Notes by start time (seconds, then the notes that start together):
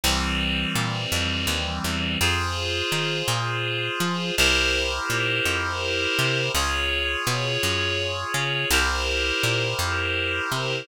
0.03 C2 E3 G3 C4
0.75 A#2
1.12 F2
1.47 D#2
1.84 E2
2.20 F2 F4 G#4 C5
2.92 D#3
3.28 A#2
4.00 F3
4.37 C2 E4 G4 A#4 C5
5.10 A#2
5.45 F2
6.19 C3
6.54 C#2 F4 G#4 C#5
7.27 B2
7.63 F#2
8.34 C#3
8.70 C2 E4 G4 A#4 C5
9.43 A#2
9.79 F2
10.52 C3